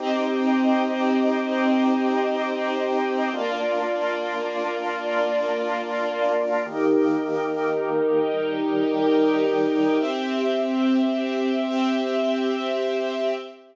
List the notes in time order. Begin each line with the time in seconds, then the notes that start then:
0.00 C4 D#4 G4 D#5
3.33 A#3 D4 F4 D5
6.66 D#3 A#3 D#4 G4 A#4
8.33 D#3 G3 G4
10.00 C4 G4 E5
11.67 C4 G4 E5